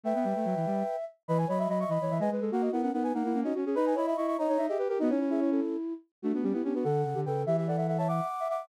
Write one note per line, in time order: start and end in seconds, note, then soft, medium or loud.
0.04 0.13 A3 medium
0.04 0.96 B4 medium
0.04 0.15 E5 medium
0.04 0.96 G5 medium
0.15 0.25 B3 medium
0.15 1.05 E5 medium
0.24 0.34 G3 medium
0.36 0.45 A3 medium
0.45 0.55 F#3 medium
0.56 0.66 E3 medium
0.66 0.83 G3 medium
1.28 1.45 E3 loud
1.28 1.46 B4 medium
1.28 1.38 D#5 medium
1.28 1.38 B5 medium
1.38 1.48 B4 medium
1.38 1.48 G#5 medium
1.47 1.67 F#3 medium
1.47 1.57 C#5 medium
1.47 1.59 D#5 medium
1.47 1.59 B5 medium
1.58 1.69 D#5 medium
1.58 1.68 E5 medium
1.58 1.69 B5 medium
1.68 1.85 F#3 medium
1.68 1.88 D#5 medium
1.68 1.79 D#5 medium
1.68 1.79 B5 medium
1.80 1.90 E5 medium
1.80 1.90 C#6 medium
1.88 1.98 E3 medium
1.88 1.99 D#5 medium
1.88 2.18 D#5 medium
1.88 2.18 B5 medium
2.01 2.10 E3 medium
2.01 2.11 C#5 medium
2.10 2.20 E3 medium
2.10 2.20 E5 medium
2.19 2.29 G#3 medium
2.19 2.30 B4 medium
2.19 2.30 D#5 medium
2.19 2.30 G#5 medium
2.30 2.40 G#3 medium
2.30 2.42 B4 medium
2.40 2.50 G#3 medium
2.40 2.51 A4 medium
2.51 2.69 A#3 medium
2.51 2.71 F#4 medium
2.51 2.62 A#4 medium
2.51 2.62 F#5 medium
2.61 2.71 F#4 medium
2.61 2.71 D#5 medium
2.72 2.90 B3 medium
2.72 2.82 E4 medium
2.72 2.82 A#4 medium
2.72 2.82 F#5 medium
2.82 2.93 C#4 medium
2.82 2.92 A#4 medium
2.82 2.92 F#5 medium
2.93 3.12 B3 medium
2.93 3.12 D#4 medium
2.93 3.03 A#4 medium
2.93 3.03 F#5 medium
3.03 3.13 B4 medium
3.03 3.13 G#5 medium
3.14 3.23 A#3 medium
3.14 3.23 D#4 medium
3.14 3.40 A#4 medium
3.14 3.40 F#5 medium
3.24 3.33 A#3 medium
3.24 3.35 E4 medium
3.34 3.43 A#3 medium
3.34 3.44 C#4 medium
3.43 3.53 C#4 medium
3.43 3.54 D#4 medium
3.43 3.54 F#4 medium
3.43 3.54 D#5 medium
3.54 3.65 C#4 medium
3.54 3.64 F#4 medium
3.65 3.75 C#4 medium
3.65 3.76 G#4 medium
3.75 3.95 D#4 medium
3.75 3.93 B4 loud
3.75 3.85 D#5 medium
3.75 3.85 B5 medium
3.86 3.96 B4 medium
3.86 3.96 G#5 medium
3.95 4.14 E4 medium
3.95 4.05 C#5 medium
3.95 4.06 D#5 medium
3.95 4.06 B5 medium
4.07 4.17 D#5 medium
4.07 4.16 E5 medium
4.07 4.17 B5 medium
4.17 4.37 E4 medium
4.17 4.35 D#5 medium
4.17 4.27 E5 medium
4.17 4.27 C#6 medium
4.27 4.37 E5 medium
4.27 4.37 C#6 medium
4.38 4.47 D#4 medium
4.38 4.66 C#5 medium
4.38 4.49 D#5 medium
4.38 4.66 A#5 medium
4.48 4.58 D#4 medium
4.48 4.58 C#5 medium
4.58 4.68 D#4 medium
4.58 4.67 E5 medium
4.67 4.78 G4 medium
4.67 4.78 G#4 medium
4.67 4.77 D#5 medium
4.67 4.78 E5 medium
4.78 4.88 G4 medium
4.78 4.88 B4 medium
4.88 4.99 G4 medium
4.88 4.98 A#4 medium
4.99 5.11 B3 loud
4.99 5.08 D#4 loud
4.99 5.09 F#4 medium
4.99 5.09 D#5 medium
5.08 5.60 C#4 medium
5.08 5.18 D#4 medium
5.08 5.19 E4 medium
5.08 5.19 C#5 medium
5.20 5.28 E4 medium
5.20 5.30 E4 medium
5.20 5.30 C#5 medium
5.29 5.93 E4 medium
5.29 5.40 G#4 medium
5.29 5.40 E5 medium
5.40 5.50 E4 medium
5.40 5.50 C#5 medium
5.51 5.76 C#4 medium
5.51 5.76 A4 medium
6.22 6.32 A3 medium
6.22 6.33 A3 medium
6.22 6.32 D4 loud
6.22 6.32 F#4 medium
6.33 6.43 A3 medium
6.33 6.44 B3 medium
6.33 6.42 D4 medium
6.33 6.43 F#4 medium
6.43 6.53 G3 medium
6.43 6.53 B3 medium
6.43 6.53 C#4 medium
6.43 6.53 G4 medium
6.52 6.62 B3 medium
6.52 6.63 B3 medium
6.52 6.64 E4 medium
6.52 6.63 G4 medium
6.64 6.74 B3 medium
6.64 6.73 C#4 medium
6.64 6.75 D4 medium
6.64 6.74 G4 medium
6.74 6.84 B3 medium
6.74 6.84 D4 medium
6.74 6.85 F#4 medium
6.74 6.84 B4 medium
6.84 7.04 D3 medium
6.84 7.20 A4 medium
6.84 7.02 A4 medium
6.84 7.20 F#5 medium
7.05 7.14 C#3 medium
7.14 7.25 D3 medium
7.14 7.24 G4 medium
7.25 7.45 C#3 medium
7.25 7.45 A4 medium
7.25 7.43 B4 medium
7.25 7.43 G5 medium
7.46 8.20 E3 medium
7.46 7.56 G4 medium
7.46 7.56 E5 medium
7.57 7.67 G4 medium
7.57 7.67 E5 medium
7.57 7.68 E5 medium
7.67 7.77 A4 medium
7.67 7.77 D5 medium
7.67 7.77 F#5 medium
7.77 7.87 A4 medium
7.77 7.87 E5 medium
7.77 7.87 F#5 medium
7.87 7.98 A4 medium
7.87 7.97 E5 medium
7.87 7.98 F#5 medium
7.98 8.08 C#5 medium
7.98 8.08 E5 medium
7.98 8.08 A5 medium
8.08 8.26 E5 medium
8.08 8.48 F#5 medium
8.08 8.48 D6 medium
8.40 8.48 E5 medium
8.49 8.66 E5 medium
8.49 8.67 F#5 medium
8.49 8.67 D6 medium